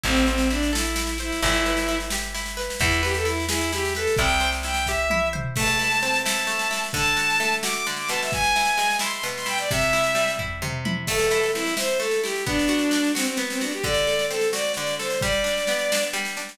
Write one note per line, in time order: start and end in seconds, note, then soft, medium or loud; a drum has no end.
0.03 1.32 A1 medium
0.03 0.26 C4 loud
0.03 0.50 E4 medium
0.03 kick medium
0.03 snare medium
0.15 snare medium
0.27 0.48 C4 medium
0.27 1.19 C5 medium
0.27 snare medium
0.38 snare medium
0.50 0.71 D4 medium
0.50 0.95 E4 medium
0.50 snare medium
0.63 snare medium
0.73 1.18 E4 medium
0.73 1.38 A4 medium
0.73 snare loud
0.85 snare medium
0.96 1.40 E4 medium
0.96 snare loud
1.07 snare medium
1.18 1.41 E4 medium
1.18 1.42 C5 medium
1.18 snare medium
1.32 snare medium
1.42 2.69 G1 medium
1.42 1.88 E4 medium
1.42 1.98 E4 medium
1.42 kick loud
1.42 snare medium
1.53 snare medium
1.66 2.57 B4 medium
1.66 snare medium
1.77 snare medium
1.88 2.34 E4 medium
1.88 snare medium
2.00 snare medium
2.10 2.77 G4 medium
2.10 snare loud
2.22 snare medium
2.34 2.78 E4 medium
2.34 snare medium
2.46 snare medium
2.57 2.79 B4 medium
2.57 snare medium
2.70 snare medium
2.80 4.07 E2 medium
2.80 3.01 E4 medium
2.80 3.25 E4 medium
2.80 kick loud
2.80 snare medium
2.91 snare medium
3.03 3.14 G4 medium
3.03 3.96 B4 medium
3.03 snare medium
3.14 3.26 A4 medium
3.14 snare medium
3.25 3.72 E4 medium
3.25 3.45 E4 medium
3.25 snare medium
3.40 snare medium
3.49 3.72 E4 medium
3.49 4.15 G#4 medium
3.49 snare loud
3.61 snare medium
3.72 4.16 E4 medium
3.72 3.94 G4 medium
3.72 snare medium
3.85 snare medium
3.95 4.15 A4 medium
3.95 4.18 B4 medium
3.95 snare medium
4.07 snare medium
4.16 5.45 C2 medium
4.16 4.64 E4 medium
4.16 4.50 G5 medium
4.16 kick loud
4.16 snare medium
4.30 snare medium
4.40 5.33 C5 medium
4.40 snare medium
4.52 snare medium
4.63 5.10 E4 medium
4.63 4.86 G5 medium
4.63 snare medium
4.74 snare medium
4.86 5.54 G4 medium
4.86 5.29 E5 medium
4.86 kick medium
4.86 snare medium
5.10 5.54 E4 medium
5.10 high tom medium
5.33 5.55 C5 medium
5.33 mid tom loud
5.56 6.47 A3 medium
5.56 6.21 A5 medium
5.56 kick loud
5.56 snare medium
5.56 crash loud
5.67 snare medium
5.79 6.25 E4 medium
5.79 snare medium
5.91 snare medium
6.02 6.90 C4 medium
6.02 snare medium
6.13 snare medium
6.25 6.70 E4 medium
6.25 6.82 A5 medium
6.25 snare loud
6.39 snare medium
6.47 6.91 A3 medium
6.47 snare medium
6.59 snare medium
6.71 6.93 E4 medium
6.71 snare medium
6.84 snare medium
6.93 7.86 D3 medium
6.93 7.54 A5 medium
6.93 kick loud
6.93 snare medium
7.06 snare medium
7.17 7.63 F#4 medium
7.17 snare medium
7.30 snare medium
7.40 8.27 A3 medium
7.40 snare medium
7.52 snare medium
7.63 8.29 F#4 medium
7.63 7.74 D6 medium
7.63 snare loud
7.73 7.86 D6 medium
7.73 snare medium
7.86 8.30 D3 medium
7.86 snare medium
7.96 8.09 D6 medium
7.96 snare medium
8.09 9.23 B2 medium
8.09 8.20 A5 medium
8.09 snare medium
8.21 8.32 E5 medium
8.21 snare medium
8.32 8.96 G#5 medium
8.32 kick loud
8.32 snare medium
8.44 snare medium
8.56 9.00 E4 medium
8.56 snare medium
8.65 snare medium
8.77 9.65 G#3 medium
8.77 snare medium
8.90 snare medium
8.99 9.45 E4 medium
8.99 9.12 C6 medium
8.99 snare loud
9.13 9.24 C6 medium
9.13 snare medium
9.23 9.67 B2 medium
9.23 snare medium
9.36 9.47 C6 medium
9.36 snare medium
9.46 9.68 E4 medium
9.46 9.58 G5 medium
9.46 snare medium
9.58 9.70 D5 medium
9.58 snare medium
9.70 10.61 C3 medium
9.70 10.31 E5 medium
9.70 kick loud
9.70 snare medium
9.81 snare medium
9.93 10.39 E4 medium
9.93 snare medium
10.04 snare medium
10.15 11.02 G3 medium
10.15 snare medium
10.28 snare medium
10.39 10.85 E4 medium
10.39 kick medium
10.39 floor tom medium
10.62 11.06 C3 medium
10.62 mid tom loud
10.85 11.07 E4 medium
10.85 high tom loud
11.07 11.99 A3 medium
11.07 11.51 A4 medium
11.07 kick loud
11.07 snare medium
11.07 crash loud
11.19 snare medium
11.31 11.77 E4 medium
11.31 snare medium
11.43 snare medium
11.54 12.43 C4 medium
11.54 11.74 E4 medium
11.54 snare medium
11.66 snare medium
11.77 12.23 E4 medium
11.77 11.99 C5 medium
11.77 snare loud
11.89 snare medium
12.00 12.43 A3 medium
12.00 12.21 A4 medium
12.00 snare medium
12.11 snare medium
12.23 12.45 E4 medium
12.23 12.44 G4 medium
12.23 snare medium
12.36 snare medium
12.46 13.37 B3 medium
12.46 13.12 D4 medium
12.46 kick loud
12.46 snare medium
12.59 snare medium
12.68 13.14 F#4 medium
12.68 snare medium
12.79 snare medium
12.91 13.80 D4 medium
12.91 snare medium
13.04 snare medium
13.15 13.26 C4 medium
13.15 13.61 F#4 medium
13.15 snare loud
13.25 13.37 C4 medium
13.25 snare medium
13.37 13.81 B3 medium
13.37 snare medium
13.49 13.60 C4 medium
13.49 snare medium
13.61 13.72 D4 medium
13.61 13.83 F#4 medium
13.61 snare medium
13.71 13.83 G4 medium
13.71 snare medium
13.83 14.77 D3 medium
13.83 14.25 D5 medium
13.83 kick loud
13.83 snare medium
13.94 snare medium
14.07 14.99 A4 medium
14.07 snare medium
14.19 snare medium
14.30 15.18 C4 medium
14.30 14.49 A4 medium
14.30 snare medium
14.41 snare medium
14.53 15.18 F#4 medium
14.53 14.72 D5 medium
14.53 snare loud
14.65 snare medium
14.74 15.21 D3 medium
14.74 14.95 D5 medium
14.74 snare medium
14.87 snare medium
14.99 15.21 A4 medium
14.99 15.21 C5 medium
14.99 snare medium
15.10 snare medium
15.21 16.13 G3 medium
15.21 16.03 D5 medium
15.21 kick loud
15.21 snare medium
15.32 snare medium
15.44 15.91 D4 medium
15.44 snare medium
15.57 snare medium
15.67 16.56 B3 medium
15.67 snare medium
15.79 snare medium
15.92 16.36 D4 medium
15.92 snare loud
16.03 snare medium
16.13 16.57 G3 medium
16.13 snare medium
16.25 snare medium
16.37 16.58 D4 medium
16.37 snare medium
16.49 snare medium